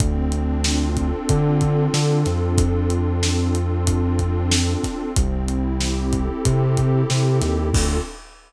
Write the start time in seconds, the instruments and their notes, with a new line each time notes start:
0.00 synth bass 2 D2, pad 2 (warm) C4, kick, closed hi-hat
0.32 pad 2 (warm) D4, closed hi-hat
0.64 pad 2 (warm) F4, snare
0.97 pad 2 (warm) A4, kick, closed hi-hat
1.29 synth bass 2 D3, pad 2 (warm) F4, kick, closed hi-hat
1.61 pad 2 (warm) D4, kick, closed hi-hat
1.94 synth bass 2 D3, pad 2 (warm) C4, snare
2.25 synth bass 2 F2, pad 2 (warm) D4, snare, closed hi-hat
2.58 pad 2 (warm) F4, kick, closed hi-hat
2.90 pad 2 (warm) A4, closed hi-hat
3.23 pad 2 (warm) F4, snare
3.55 pad 2 (warm) D4, closed hi-hat
3.87 pad 2 (warm) C4, kick, closed hi-hat
4.17 pad 2 (warm) D4, kick, closed hi-hat
4.51 pad 2 (warm) F4, snare
4.82 pad 2 (warm) A4, kick, snare, closed hi-hat
5.16 synth bass 2 C2, pad 2 (warm) C4, kick, closed hi-hat
5.48 pad 2 (warm) E4, closed hi-hat
5.81 pad 2 (warm) G4, snare
6.13 pad 2 (warm) A4, kick, closed hi-hat
6.45 synth bass 2 C3, pad 2 (warm) G4, kick, closed hi-hat
6.77 pad 2 (warm) E4, kick, closed hi-hat
7.10 synth bass 2 C3, pad 2 (warm) C4, snare
7.42 synth bass 2 D#2, pad 2 (warm) E4, snare, closed hi-hat
7.73 synth bass 2 D2, pad 2 (warm) C4 D4 F4 A4, kick, crash